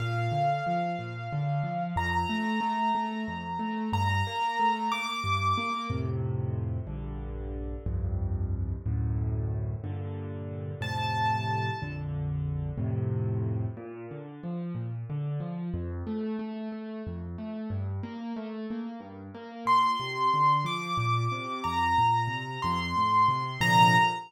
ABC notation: X:1
M:6/8
L:1/8
Q:3/8=61
K:Bb
V:1 name="Acoustic Grand Piano"
f6 | b6 | b3 d'3 | [K:F] z6 |
z6 | z3 a3 | z6 | [K:Bb] z6 |
z6 | z6 | c'3 d'3 | b3 c'3 |
b3 z3 |]
V:2 name="Acoustic Grand Piano"
B,, D, F, B,, D, F, | F,, A, A, A, F,, A, | G,, B, A, B, G,, B, | [K:F] [F,,A,,C,]3 [B,,,G,,D,]3 |
[C,,F,,G,,]3 [D,,^F,,A,,]3 | [G,,B,,D,]3 [F,,A,,C,]3 | [B,,,F,,D,]3 [F,,A,,C,]3 | [K:Bb] B,, D, F, B,, D, F, |
F,, A, A, A, F,, A, | G,, B, A, B, G,, B, | B,, C, D, F, B,, C, | F,, B,, C, F,, A,, C, |
[B,,C,D,F,]3 z3 |]